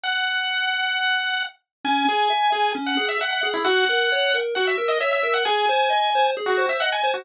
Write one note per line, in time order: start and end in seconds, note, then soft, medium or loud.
0.03 1.43 F#5 medium
1.84 2.05 C#4 loud
1.84 2.71 G#5 loud
2.09 2.29 G#4 medium
2.30 2.50 E5 medium
2.52 2.73 G#4 medium
2.75 2.95 C#4 loud
2.86 3.06 F#5 medium
2.97 3.17 G#4 medium
3.09 3.19 E5 medium
3.21 3.41 E5 loud
3.21 3.30 F#5 medium
3.31 3.50 F#5 medium
3.43 3.63 G#4 medium
3.54 3.64 E4 medium
3.65 3.85 F#4 loud
3.65 4.37 F#5 loud
3.89 4.09 A#4 medium
4.12 4.32 C#5 medium
4.34 4.54 A#4 medium
4.55 4.76 F#4 medium
4.55 4.66 F#5 medium
4.67 4.89 E5 medium
4.78 4.98 A#4 medium
4.88 4.99 D#5 medium
5.00 5.21 C#5 medium
5.00 5.11 E5 medium
5.13 5.32 E5 medium
5.23 5.44 A#4 medium
5.34 5.44 F#5 medium
5.45 5.66 G#4 loud
5.45 6.27 G#5 loud
5.69 5.89 C5 loud
5.90 6.10 D#5 medium
6.15 6.35 C5 loud
6.37 6.57 G#4 loud
6.46 6.66 F#4 medium
6.57 6.78 C5 medium
6.69 6.80 E5 medium
6.80 7.02 D#5 medium
6.80 6.91 F#5 medium
6.92 7.11 G#5 medium
7.03 7.24 C5 medium
7.14 7.25 F#4 medium